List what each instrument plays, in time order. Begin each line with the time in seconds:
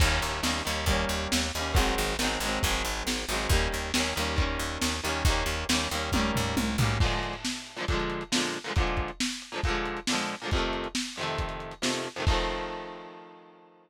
0.00 electric bass (finger) D#2, overdriven guitar D#3 G3, kick, crash
0.05 overdriven guitar A#3 C#4
0.22 electric bass (finger) D#2, closed hi-hat
0.43 electric bass (finger) D#2, overdriven guitar D#3 G3 A#3, snare
0.48 overdriven guitar C#4
0.65 electric bass (finger) D#2, overdriven guitar D#3 G3 A#3, closed hi-hat
0.71 overdriven guitar C#4
0.86 electric bass (finger) D#2, overdriven guitar D#3 G3, kick, closed hi-hat
0.91 overdriven guitar A#3 C#4
1.09 electric bass (finger) D#2, closed hi-hat
1.32 electric bass (finger) D#2, snare
1.53 electric bass (finger) D#2, overdriven guitar D#3, open hi-hat
1.57 overdriven guitar G3 A#3 C#4
1.74 electric bass (finger) G#1, overdriven guitar D#3 F#3 G#3, kick, closed hi-hat
1.79 overdriven guitar C4
1.98 electric bass (finger) G#1, closed hi-hat
2.19 electric bass (finger) G#1, overdriven guitar D#3 F#3, snare
2.23 overdriven guitar G#3 C4
2.40 electric bass (finger) G#1, overdriven guitar D#3 F#3, closed hi-hat
2.46 overdriven guitar G#3 C4
2.63 electric bass (finger) G#1, overdriven guitar D#3 F#3 G#3, kick, closed hi-hat
2.69 overdriven guitar C4
2.85 electric bass (finger) G#1, closed hi-hat
3.07 electric bass (finger) G#1, snare
3.28 electric bass (finger) G#1, overdriven guitar D#3 F#3, open hi-hat
3.33 overdriven guitar G#3 C4
3.49 electric bass (finger) D#2, overdriven guitar D#3 G3, kick, closed hi-hat
3.54 overdriven guitar A#3 C#4
3.72 electric bass (finger) D#2, closed hi-hat
3.94 electric bass (finger) D#2, overdriven guitar D#3 G3 A#3, snare
4.00 overdriven guitar C#4
4.16 electric bass (finger) D#2, overdriven guitar D#3 G3 A#3, closed hi-hat
4.21 overdriven guitar C#4
4.36 overdriven guitar D#3 G3 A#3, kick, closed hi-hat
4.42 overdriven guitar C#4
4.59 electric bass (finger) D#2, closed hi-hat
4.81 electric bass (finger) D#2, snare
5.03 electric bass (finger) D#2, overdriven guitar D#3 G3 A#3, closed hi-hat
5.09 overdriven guitar C#4
5.25 electric bass (finger) D#2, overdriven guitar D#3 G3, kick, closed hi-hat
5.30 overdriven guitar A#3 C#4
5.46 electric bass (finger) D#2, closed hi-hat
5.69 electric bass (finger) D#2, overdriven guitar D#3 G3 A#3, snare
5.75 overdriven guitar C#4
5.91 electric bass (finger) D#2, overdriven guitar D#3 G3 A#3, closed hi-hat
5.97 overdriven guitar C#4
6.12 electric bass (finger) D#2, overdriven guitar D#3 G3, kick, high tom
6.17 overdriven guitar A#3 C#4
6.35 electric bass (finger) D#2, floor tom
6.57 electric bass (finger) C2, high tom
6.78 electric bass (finger) B1, overdriven guitar D#3 G3, floor tom
6.82 overdriven guitar A#3 C#4
7.00 overdriven guitar A#2 D3 F3, kick, crash
7.06 overdriven guitar G#3
7.12 closed hi-hat
7.23 closed hi-hat
7.33 closed hi-hat
7.45 snare
7.56 closed hi-hat
7.67 closed hi-hat
7.77 overdriven guitar A#2 D3 F3, closed hi-hat
7.82 overdriven guitar G#3
7.88 overdriven guitar A#2 D3 F3, kick, closed hi-hat
7.94 overdriven guitar G#3
8.00 closed hi-hat
8.10 closed hi-hat
8.21 closed hi-hat
8.32 overdriven guitar A#2 D3 F3, snare
8.37 overdriven guitar G#3
8.43 closed hi-hat
8.54 closed hi-hat
8.64 overdriven guitar A#2 D3 F3, closed hi-hat
8.70 overdriven guitar G#3
8.76 overdriven guitar A#2 D3 F3, kick, closed hi-hat
8.81 overdriven guitar G#3
8.87 closed hi-hat
8.97 kick, closed hi-hat
9.08 closed hi-hat
9.20 snare
9.31 closed hi-hat
9.42 closed hi-hat
9.52 overdriven guitar A#2 D3 F3, closed hi-hat
9.57 overdriven guitar G#3
9.64 overdriven guitar A#2 D3, kick, closed hi-hat
9.68 overdriven guitar F3 G#3
9.75 closed hi-hat
9.86 closed hi-hat
9.97 closed hi-hat
10.07 overdriven guitar A#2 D3, snare
10.13 overdriven guitar F3 G#3
10.18 closed hi-hat
10.29 closed hi-hat
10.40 overdriven guitar A#2 D3, closed hi-hat
10.45 overdriven guitar F3 G#3
10.51 overdriven guitar F2 C3, kick, closed hi-hat
10.56 overdriven guitar D#3 A3
10.62 closed hi-hat
10.73 closed hi-hat
10.84 closed hi-hat
10.95 snare
11.06 closed hi-hat
11.16 overdriven guitar F2 C3, closed hi-hat
11.21 overdriven guitar D#3 A3
11.28 closed hi-hat
11.38 kick, closed hi-hat
11.49 closed hi-hat
11.60 closed hi-hat
11.71 closed hi-hat
11.82 overdriven guitar F2 C3 D#3, snare
11.87 overdriven guitar A3
11.94 closed hi-hat
12.04 closed hi-hat
12.16 overdriven guitar F2 C3 D#3, closed hi-hat
12.22 overdriven guitar A3
12.27 overdriven guitar D#3 F3, kick, crash
12.32 overdriven guitar A3 C4